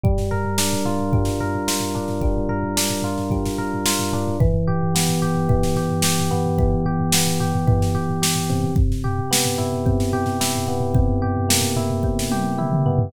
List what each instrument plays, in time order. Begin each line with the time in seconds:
0.04 electric piano 1 G3, kick, floor tom
0.18 snare, floor tom
0.31 electric piano 1 A#4, floor tom
0.45 floor tom
0.58 electric piano 1 D4, snare
0.73 floor tom
0.85 electric piano 1 F4, floor tom
0.99 floor tom
1.13 electric piano 1 G3, kick, floor tom
1.25 snare, floor tom
1.40 electric piano 1 A#4, floor tom
1.55 floor tom
1.68 electric piano 1 F4, snare
1.80 floor tom
1.95 electric piano 1 D4, floor tom
2.08 snare, floor tom
2.21 electric piano 1 G3, kick, floor tom
2.36 floor tom
2.49 electric piano 1 A#4, floor tom
2.63 floor tom
2.77 electric piano 1 D4, snare
2.90 floor tom
3.02 electric piano 1 F4, floor tom
3.18 snare, floor tom
3.30 electric piano 1 G3, kick, floor tom
3.46 snare, floor tom
3.58 electric piano 1 A#4, floor tom
3.74 floor tom
3.86 electric piano 1 F4, snare
3.99 snare, floor tom
4.13 electric piano 1 D4, floor tom
4.27 floor tom
4.40 electric piano 1 E3, kick, floor tom
4.52 floor tom
4.68 electric piano 1 G4, floor tom
4.82 floor tom
4.95 electric piano 1 B3, snare
5.09 floor tom
5.22 electric piano 1 G4, floor tom
5.35 floor tom
5.49 electric piano 1 E3, kick, floor tom
5.63 snare, floor tom
5.76 electric piano 1 G4, snare, floor tom
5.89 floor tom
6.02 electric piano 1 G4, snare
6.18 snare, floor tom
6.31 electric piano 1 B3, floor tom
6.46 floor tom
6.58 electric piano 1 E3, kick, floor tom
6.73 floor tom
6.86 electric piano 1 G4, floor tom
6.99 floor tom
7.12 electric piano 1 B3, snare
7.27 floor tom
7.40 electric piano 1 G4, floor tom
7.54 floor tom
7.67 electric piano 1 E3, kick, floor tom
7.80 snare, floor tom
7.95 electric piano 1 G4, floor tom
8.09 floor tom
8.22 electric piano 1 G4, snare
8.36 floor tom
8.50 electric piano 1 C3, snare, floor tom
8.64 floor tom
8.76 kick, floor tom
8.91 snare, floor tom
9.04 electric piano 1 G4, floor tom
9.19 floor tom
9.31 electric piano 1 B3, snare
9.45 floor tom
9.58 electric piano 1 E4, floor tom
9.73 floor tom
9.86 electric piano 1 C3, kick, floor tom
9.99 snare, floor tom
10.13 electric piano 1 G4, floor tom
10.26 snare, floor tom
10.40 electric piano 1 E4, snare
10.55 floor tom
10.68 electric piano 1 B3, floor tom
10.80 floor tom
10.94 electric piano 1 C3, kick, floor tom
11.08 floor tom
11.22 electric piano 1 G4, floor tom
11.36 floor tom
11.49 electric piano 1 A#3, snare
11.61 floor tom
11.76 electric piano 1 E4, floor tom
11.90 floor tom
12.03 electric piano 1 C3, kick
12.19 snare
12.31 electric piano 1 G4, high tom
12.58 electric piano 1 E4, mid tom
12.72 mid tom
12.86 electric piano 1 B3, floor tom
12.99 floor tom